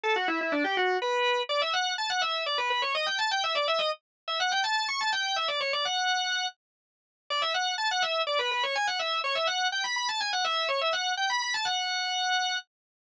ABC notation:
X:1
M:3/4
L:1/16
Q:1/4=124
K:G
V:1 name="Drawbar Organ"
A F E E D G F2 B4 | [K:D] d e f2 a f e2 d B B c | ^d g a g e =d e ^d z3 e | f g a2 c' a g2 e d c d |
f6 z6 | d e f2 a f e2 d B B c | ^g f e2 c e f2 =g b b a | ^g f e2 c e f2 =g b b a |
f8 z4 |]